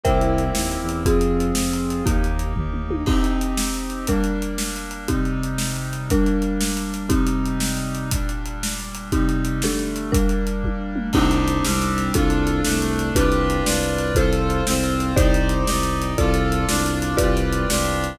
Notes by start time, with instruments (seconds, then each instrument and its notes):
0.04 violin C2, brass section A#3 C4 E4 G4, marimba A#4 C5 E5 G5, kick, closed hi-hat
0.21 closed hi-hat
0.38 closed hi-hat
0.55 violin D#2, snare
0.71 closed hi-hat
0.81 violin E2
0.89 closed hi-hat
1.05 violin F2, brass section C4 F4 G#4, marimba C4 F4 G#4, kick, closed hi-hat
1.21 closed hi-hat
1.40 closed hi-hat
1.55 violin F2, snare
1.73 closed hi-hat
1.90 closed hi-hat
2.06 violin D#2, marimba A#3 D#4 G4, brass section A#3 D#4 G4, kick, closed hi-hat
2.24 closed hi-hat
2.39 closed hi-hat
2.56 violin D#2, kick, floor tom
2.73 mid tom
2.91 high tom
3.06 brass section C4 D#4 G4, marimba C4 D#4 G4, kick, crash
3.24 closed hi-hat
3.41 closed hi-hat
3.57 snare
3.74 closed hi-hat
3.90 closed hi-hat
4.07 brass section G3 A#3 D4, marimba G3 D4 A#4, kick, closed hi-hat
4.24 closed hi-hat
4.42 closed hi-hat
4.58 snare
4.76 closed hi-hat
4.91 closed hi-hat
5.08 brass section C3 G3 D#4, marimba C4 D#4 G4, kick, closed hi-hat
5.25 closed hi-hat
5.43 closed hi-hat
5.58 snare
5.76 closed hi-hat
5.93 closed hi-hat
6.10 brass section G3 A#3 D4, marimba G3 D4 A#4, kick, closed hi-hat
6.26 closed hi-hat
6.42 closed hi-hat
6.61 snare
6.77 closed hi-hat
6.94 closed hi-hat
7.09 brass section C3 G3 D#4, marimba C4 D#4 G4, kick, closed hi-hat
7.27 closed hi-hat
7.46 closed hi-hat
7.60 snare
7.77 closed hi-hat
7.95 closed hi-hat
8.11 brass section A#2 G3 D4, kick, closed hi-hat
8.29 closed hi-hat
8.46 closed hi-hat
8.63 snare
8.80 closed hi-hat
8.95 closed hi-hat
9.12 brass section C3 G3 D#4, marimba C4 D#4 G4, kick, closed hi-hat
9.29 closed hi-hat
9.45 closed hi-hat
9.62 brass section D3 G3 A3, marimba D4 G4 A4, snare
9.79 closed hi-hat
9.96 closed hi-hat
10.12 marimba G3 D4 A#4, brass section G3 A#3 D4, kick, closed hi-hat
10.29 closed hi-hat
10.47 closed hi-hat
10.64 kick, high tom
10.96 mid tom
11.13 violin C2, brass section C4 D4 D#4 G4, marimba C4 D4 D#4 G4, kick, crash
11.31 closed hi-hat
11.48 closed hi-hat
11.64 violin C2, brass section G3 C4 D4 G4, snare
11.82 closed hi-hat
11.98 closed hi-hat
12.14 violin C2, brass section D4 F4 A4, marimba D4 F4 A4, kick, closed hi-hat
12.30 closed hi-hat
12.47 closed hi-hat
12.64 violin C2, brass section A3 D4 A4, snare
12.82 closed hi-hat
12.99 closed hi-hat
13.15 violin C2, marimba D4 F4 G4 B4, brass section D4 F4 G4 B4, kick, closed hi-hat
13.32 closed hi-hat
13.50 closed hi-hat
13.65 violin C2, brass section D4 F4 B4 D5, snare
13.83 closed hi-hat
13.98 closed hi-hat
14.15 violin C2, brass section F4 A4 C5, marimba F4 A4 C5, kick, closed hi-hat
14.33 closed hi-hat
14.50 closed hi-hat
14.66 violin C2, brass section C4 F4 C5, snare
14.84 closed hi-hat
15.00 closed hi-hat
15.16 violin C2, marimba D#4 G4 C5 D5, brass section D#4 G4 C5 D5, kick, closed hi-hat
15.34 closed hi-hat
15.49 closed hi-hat
15.67 violin C2, brass section D#4 G4 D5 D#5, snare
15.83 closed hi-hat
16.02 closed hi-hat
16.18 violin C2, marimba F4 A4 D5, brass section F4 A4 D5, kick, closed hi-hat
16.34 closed hi-hat
16.52 closed hi-hat
16.68 violin C2, brass section D4 F4 D5, snare
16.86 closed hi-hat
17.02 closed hi-hat
17.17 violin C2, marimba F4 G4 B4 D5, brass section F4 G4 B4 D5, kick, closed hi-hat
17.37 closed hi-hat
17.53 closed hi-hat
17.69 violin C2, brass section D4 F4 G4 D5, snare
17.85 closed hi-hat
18.04 closed hi-hat